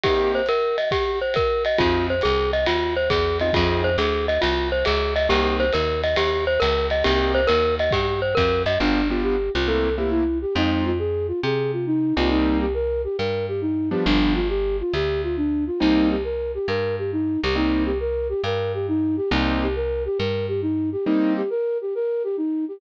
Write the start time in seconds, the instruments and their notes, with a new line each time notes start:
0.04 acoustic grand piano A#3 C4 D#4 G4, glockenspiel G4, kick, ride
0.35 glockenspiel C5
0.46 glockenspiel A#4, hi-hat pedal, ride
0.78 glockenspiel D#5, ride
0.91 glockenspiel G4, kick, ride
1.22 glockenspiel C5
1.34 glockenspiel A#4, kick, hi-hat pedal, ride
1.65 glockenspiel D#5, ride
1.78 electric bass (finger) F2, acoustic grand piano C4 D#4 F4 G#4, glockenspiel F4, kick, ride
2.10 glockenspiel C5
2.21 electric bass (finger) C2, glockenspiel G#4, hi-hat pedal, ride
2.53 glockenspiel D#5, ride
2.66 electric bass (finger) D#2, glockenspiel F4, ride
2.97 glockenspiel C5
3.10 electric bass (finger) E2, glockenspiel G#4, kick, hi-hat pedal, ride
3.40 acoustic grand piano C4 D#4 F4 G#4, glockenspiel D#5, ride
3.53 electric bass (finger) F2, acoustic grand piano C4 D#4 F4 G#4, glockenspiel F4, kick, ride
3.84 glockenspiel C5
3.98 electric bass (finger) D2, glockenspiel G#4, hi-hat pedal, ride
4.28 glockenspiel D#5, ride
4.42 electric bass (finger) C2, glockenspiel F4, ride
4.72 glockenspiel C5
4.85 electric bass (finger) C#2, glockenspiel G#4, hi-hat pedal, ride
5.16 glockenspiel D#5, ride
5.29 electric bass (finger) C2, acoustic grand piano A#3 C4 D#4 G4, glockenspiel G4, ride
5.60 glockenspiel C5, ride
5.73 electric bass (finger) D#2, glockenspiel A#4, hi-hat pedal, ride
6.04 glockenspiel D#5, ride
6.16 electric bass (finger) D#2, glockenspiel G4, ride
6.47 glockenspiel C5
6.60 electric bass (finger) C#2, glockenspiel A#4, hi-hat pedal, ride
6.90 glockenspiel D#5, ride
7.04 electric bass (finger) C2, acoustic grand piano A#3 C4 D#4 G4, glockenspiel G4, ride
7.35 glockenspiel C5
7.47 electric bass (finger) D#2, glockenspiel A#4, hi-hat pedal, ride
7.79 glockenspiel D#5, ride
7.91 electric bass (finger) G2, glockenspiel G4, kick, ride
8.22 glockenspiel C5
8.35 electric bass (finger) F2, glockenspiel A#4, kick, hi-hat pedal, ride
8.66 electric bass (finger) F#2, glockenspiel D#5, ride
8.80 electric bass (finger) G1, acoustic grand piano B3 D4 F4 G4, flute D4
9.10 acoustic grand piano B3 D4 F4 G4, flute F4
9.23 flute G4
9.54 electric bass (finger) C2, flute F4
9.67 acoustic grand piano A3 A#3 C4 E4, flute A4
9.98 acoustic grand piano A3 A#3 C4 E4, flute G4
10.11 flute E4
10.42 flute G4
10.55 electric bass (finger) F2, acoustic grand piano G#3 C4 D#4 F4, flute D#4
10.86 flute F4
10.99 flute G#4
11.28 flute F4
11.43 electric bass (finger) C3, flute G#4
11.73 flute F4
11.87 flute D#4
12.17 electric bass (finger) C2, acoustic grand piano G3 A#3 C4 D#4, flute F4
12.31 flute D#4
12.61 flute G4
12.74 flute A#4
13.04 flute G4
13.18 electric bass (finger) G2, flute A#4
13.48 flute G4
13.61 flute D#4
13.91 acoustic grand piano F3 G3 B3 D4, flute G4
14.05 electric bass (finger) G1, flute D4
14.35 flute F4
14.49 flute G4
14.80 flute F4
14.94 electric bass (finger) D2, flute G4
15.24 flute F4
15.37 flute D4
15.67 flute F4
15.80 electric bass (finger) C2, acoustic grand piano G3 A#3 C4 D#4, flute D#4
16.10 flute G4
16.24 flute A#4
16.54 flute G4
16.68 electric bass (finger) G2, flute A#4
16.99 flute G4
17.12 flute D#4
17.43 electric bass (finger) C2, flute G4
17.56 acoustic grand piano G3 A#3 C4 D#4, flute D#4
17.86 flute G4
18.00 flute A#4
18.29 flute G4
18.44 electric bass (finger) G2, flute A#4
18.74 flute G4
18.88 flute D#4
19.17 flute G4
19.31 electric bass (finger) C2, acoustic grand piano G3 A#3 C4 D#4, flute D#4
19.62 flute G4
19.76 flute A#4
20.05 flute G4
20.18 electric bass (finger) G2, flute A#4
20.48 flute G4
20.62 flute D#4
20.92 flute G4
21.05 acoustic grand piano G3 A#3 C4 D#4, flute D#4
21.37 flute G4
21.50 flute A#4
21.81 flute G4
21.95 flute A#4
22.24 flute G4
22.37 flute D#4
22.68 flute G4